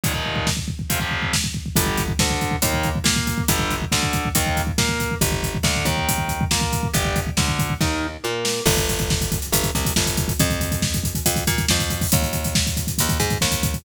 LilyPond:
<<
  \new Staff \with { instrumentName = "Overdriven Guitar" } { \time 4/4 \key g \minor \tempo 4 = 139 <ees, bes, ees>16 <ees, bes, ees>4.~ <ees, bes, ees>16 <f, c f>16 <f, c f>4.~ <f, c f>16 | <d g>8. r16 d4 <ees bes>8. r16 bes4 | <d g>8. r16 d4 <ees bes>8. r16 bes4 | r4 d8 ees4. bes4 |
<d' g'>8. r16 d4 <ees' bes'>8. r16 bes4 | r1 | r1 | r1 | }
  \new Staff \with { instrumentName = "Electric Bass (finger)" } { \clef bass \time 4/4 \key g \minor r1 | g,,4 d,4 ees,4 bes,4 | g,,4 d,4 ees,4 bes,4 | g,,4 d,8 ees,4. bes,4 |
g,,4 d,4 ees,4 bes,4 | g,,2 g,,8 c,8 g,,4 | f,2 f,8 bes,8 f,4 | ees,2 ees,8 aes,8 ees,4 | }
  \new DrumStaff \with { instrumentName = "Drums" } \drummode { \time 4/4 <hh bd>16 bd16 bd16 bd16 <bd sn>16 bd16 bd16 bd16 <hh bd>16 bd16 bd16 bd16 <bd sn>16 bd16 bd16 bd16 | <hh bd>16 bd16 <hh bd>16 bd16 <bd sn>16 bd16 <hh bd>16 bd16 <hh bd>16 bd16 <hh bd>16 bd16 <bd sn>16 bd16 <hh bd>16 bd16 | <hh bd>16 bd16 <hh bd>16 bd16 <bd sn>16 bd16 <hh bd>16 bd16 <hh bd>16 bd16 <hh bd>16 bd16 <bd sn>16 bd16 <hh bd>16 bd16 | <hh bd>16 bd16 <hh bd>16 bd16 <bd sn>16 bd16 <hh bd>16 bd16 <hh bd>16 bd16 <hh bd>16 bd16 <bd sn>16 bd16 <hh bd>16 bd16 |
<hh bd>16 bd16 <hh bd>16 bd16 <bd sn>16 bd16 <hh bd>16 bd16 <bd sn>4 r8 sn8 | <cymc bd>16 <hh bd>16 <hh bd>16 <hh bd>16 <bd sn>16 <hh bd>16 <hh bd>16 hh16 <hh bd>16 <hh bd>16 <hh bd>16 <hh bd>16 <bd sn>16 <hh bd>16 <hh bd>16 <hh bd>16 | <hh bd>16 <hh bd>16 <hh bd>16 <hh bd>16 <bd sn>16 <hh bd>16 <hh bd>16 <hh bd>16 <hh bd>16 <hh bd>16 <hh bd>16 <hh bd>16 <bd sn>16 <hh bd>16 <hh bd>16 <hho bd>16 | <hh bd>16 <hh bd>16 <hh bd>16 <hh bd>16 <bd sn>16 <hh bd>16 <hh bd>16 <hh bd>16 <hh bd>16 <hh bd>16 <hh bd>16 <hh bd>16 <bd sn>16 <hh bd>16 <hh bd>16 <hh bd>16 | }
>>